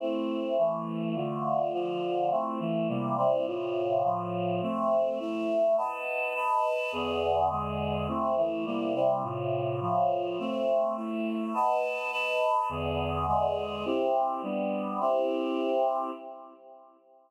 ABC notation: X:1
M:2/2
L:1/8
Q:1/2=104
K:Am
V:1 name="Choir Aahs"
[A,CE]4 [E,A,E]4 | [D,A,F]4 [D,F,F]4 | [A,CE]2 [E,A,E]2 [C,G,_B,E]2 [C,G,CE]2 | [A,,C,F]4 [A,,F,F]4 |
[A,Ce]4 [A,Ee]4 | [B^d^fa]4 [Bdab]4 | [E,,D,B,^G]4 [E,,D,^G,G]4 | [A,CE]2 [E,A,E]2 [C,G,_B,E]2 [C,G,CE]2 |
[A,,C,F]4 [A,,F,F]4 | [A,Ce]4 [A,Ee]4 | [B^d^fa]4 [Bdab]4 | [E,,D,B,^G]4 [E,,D,^G,G]4 |
[K:C] [CEG]4 [G,B,D]4 | [CEG]8 |]